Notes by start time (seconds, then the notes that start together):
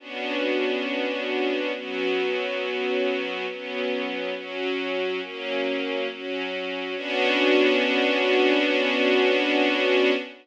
0.00 B3 C#4 D4 F#4
1.74 F#3 B3 C#4 F#4
3.48 F#3 B3 C#4
4.35 F#3 C#4 F#4
5.21 F#3 A#3 C#4
6.09 F#3 C#4 F#4
6.96 B3 C#4 D4 F#4